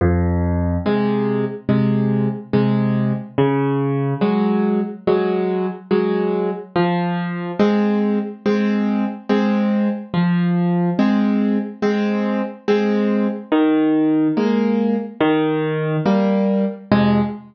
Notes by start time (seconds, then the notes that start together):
0.01 F2
0.86 C3 G#3
1.69 C3 G#3
2.53 C3 G#3
3.38 C#3
4.21 F#3 G#3
5.07 F#3 G#3
5.91 F#3 G#3
6.76 F3
7.60 G#3 C4
8.46 G#3 C4
9.29 G#3 C4
10.14 F3
10.99 G#3 C4
11.82 G#3 C4
12.68 G#3 C4
13.52 D#3
14.37 G#3 A#3
15.21 D#3
16.06 G3 A#3
16.92 F2 C3 G#3